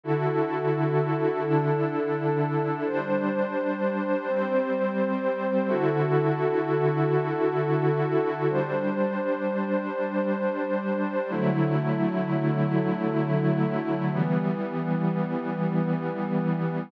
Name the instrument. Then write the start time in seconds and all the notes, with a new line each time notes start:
pad 5 (bowed)
0.04 D3 E4 F#4 A4
1.44 D3 D4 E4 A4
2.86 G3 D4 C5
4.27 G3 C4 C5
5.67 D3 E4 F#4 A4
8.49 G3 D4 C5
11.30 D3 F#3 A3 E4
14.11 E3 G3 B3